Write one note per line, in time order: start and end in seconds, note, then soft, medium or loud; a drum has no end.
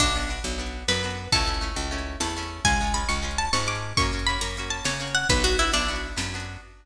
0.00 0.40 B1 medium
0.00 0.14 B3 medium
0.00 0.79 D4 medium
0.00 0.14 D4 loud
0.00 0.14 F#4 loud
0.00 kick medium
0.00 crash medium
0.15 0.29 B3 medium
0.15 0.29 D4 medium
0.15 0.29 F#4 medium
0.22 closed hi-hat medium
0.29 0.56 B3 medium
0.29 0.56 D4 medium
0.29 0.56 F#4 medium
0.44 0.84 B1 medium
0.44 closed hi-hat medium
0.58 0.86 B3 medium
0.58 0.86 D4 medium
0.58 0.86 F#4 medium
0.66 closed hi-hat medium
0.88 1.28 F#2 medium
0.88 1.02 B3 medium
0.88 1.02 D4 medium
0.88 1.02 F#4 medium
0.88 1.25 B4 medium
0.88 snare medium
1.03 1.30 B3 medium
1.03 1.30 D4 medium
1.03 1.30 F#4 medium
1.10 closed hi-hat medium
1.32 1.72 C#2 medium
1.32 1.46 A3 medium
1.32 1.46 C#4 medium
1.32 1.46 E4 medium
1.32 2.14 A4 medium
1.32 kick loud
1.32 closed hi-hat medium
1.46 1.60 A3 medium
1.46 1.60 C#4 medium
1.46 1.60 E4 medium
1.54 closed hi-hat medium
1.61 1.88 A3 medium
1.61 1.88 C#4 medium
1.61 1.88 E4 medium
1.76 2.16 C#2 medium
1.76 closed hi-hat medium
1.91 2.18 A3 medium
1.91 2.18 C#4 loud
1.91 2.18 E4 medium
1.98 closed hi-hat medium
2.20 2.60 E2 medium
2.20 2.34 A3 medium
2.20 2.34 C#4 medium
2.20 2.34 E4 medium
2.20 2.59 A5 medium
2.20 snare medium
2.36 2.63 A3 medium
2.36 2.63 C#4 medium
2.36 2.63 E4 medium
2.43 closed hi-hat medium
2.65 3.04 C#2 medium
2.65 2.78 G#3 loud
2.65 2.78 C#4 loud
2.65 2.78 F4 medium
2.65 2.93 G#5 medium
2.65 kick loud
2.65 closed hi-hat medium
2.81 2.93 G#3 medium
2.81 2.94 C#4 medium
2.81 2.94 F4 medium
2.87 closed hi-hat medium
2.94 3.21 G#3 medium
2.94 3.21 C#4 medium
2.94 3.21 F4 medium
2.94 3.08 B5 medium
3.09 3.49 C#2 medium
3.09 3.37 C#6 medium
3.09 closed hi-hat medium
3.22 3.49 G#3 medium
3.22 3.49 C#4 medium
3.22 3.49 F4 medium
3.31 closed hi-hat medium
3.38 3.51 A5 medium
3.53 3.93 G#2 medium
3.53 3.66 G#3 medium
3.53 3.67 C#4 medium
3.53 3.68 F4 medium
3.53 3.66 C#6 medium
3.53 snare loud
3.66 3.94 G#3 medium
3.66 3.94 C#4 medium
3.66 3.94 F4 medium
3.66 3.96 D6 medium
3.75 closed hi-hat medium
3.97 4.37 F#2 medium
3.97 4.12 A#3 loud
3.97 4.12 C#4 loud
3.97 4.12 F#4 loud
3.97 4.21 C#6 medium
3.97 kick medium
3.97 closed hi-hat medium
4.13 4.26 A#3 medium
4.13 4.26 C#4 medium
4.13 4.26 F#4 medium
4.19 closed hi-hat medium
4.27 4.54 A#3 medium
4.27 4.54 C#4 medium
4.27 4.54 F#4 medium
4.27 4.41 B5 medium
4.41 4.81 F#2 medium
4.41 4.55 A#5 medium
4.41 closed hi-hat loud
4.57 4.84 A#3 medium
4.57 4.84 C#4 medium
4.57 4.84 F#4 medium
4.63 closed hi-hat medium
4.70 4.83 A5 medium
4.84 5.25 C#3 medium
4.84 4.98 A#3 medium
4.84 4.98 C#4 medium
4.84 4.98 F#4 medium
4.84 5.11 C#5 medium
4.84 snare loud
5.00 5.27 A#3 medium
5.00 5.27 C#4 medium
5.00 5.27 F#4 medium
5.07 closed hi-hat medium
5.15 5.27 F#5 medium
5.29 5.69 B1 medium
5.29 5.43 B3 loud
5.29 5.44 D4 medium
5.29 5.44 F#4 medium
5.29 5.43 B4 medium
5.29 kick loud
5.29 closed hi-hat loud
5.44 5.57 B3 medium
5.44 5.57 D4 medium
5.44 5.57 F#4 medium
5.52 closed hi-hat medium
5.59 5.87 B3 medium
5.59 5.87 D4 medium
5.59 5.71 E4 medium
5.59 5.87 F#4 medium
5.73 6.13 B1 medium
5.73 6.42 D4 medium
5.73 closed hi-hat loud
5.88 6.15 B3 loud
5.88 6.15 D4 medium
5.88 6.15 F#4 medium
5.96 closed hi-hat medium
6.16 6.57 F#2 medium
6.16 6.30 B3 medium
6.16 6.30 D4 medium
6.16 6.30 F#4 medium
6.16 snare loud
6.34 6.61 B3 medium
6.34 6.61 D4 medium
6.34 6.61 F#4 medium
6.40 closed hi-hat medium